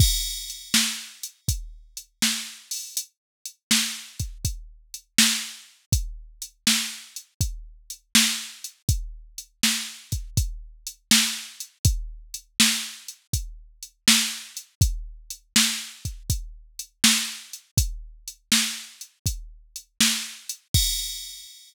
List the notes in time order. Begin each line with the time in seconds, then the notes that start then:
0.00 kick, crash
0.50 closed hi-hat
0.74 snare
1.23 closed hi-hat
1.48 kick, closed hi-hat
1.97 closed hi-hat
2.22 snare
2.71 open hi-hat
2.97 closed hi-hat
3.46 closed hi-hat
3.71 snare
4.19 kick, closed hi-hat
4.45 kick, closed hi-hat
4.94 closed hi-hat
5.18 snare
5.92 kick, closed hi-hat
6.42 closed hi-hat
6.67 snare
7.16 closed hi-hat
7.41 kick, closed hi-hat
7.90 closed hi-hat
8.15 snare
8.64 closed hi-hat
8.89 kick, closed hi-hat
9.38 closed hi-hat
9.63 snare
10.12 kick, closed hi-hat
10.37 kick, closed hi-hat
10.87 closed hi-hat
11.11 snare
11.60 closed hi-hat
11.85 kick, closed hi-hat
12.34 closed hi-hat
12.60 snare
13.08 closed hi-hat
13.33 kick, closed hi-hat
13.83 closed hi-hat
14.08 snare
14.57 closed hi-hat
14.81 kick, closed hi-hat
15.30 closed hi-hat
15.56 snare
16.05 kick, closed hi-hat
16.30 kick, closed hi-hat
16.79 closed hi-hat
17.04 snare
17.53 closed hi-hat
17.77 kick, closed hi-hat
18.28 closed hi-hat
18.52 snare
19.01 closed hi-hat
19.26 kick, closed hi-hat
19.76 closed hi-hat
20.00 snare
20.49 closed hi-hat
20.74 kick, crash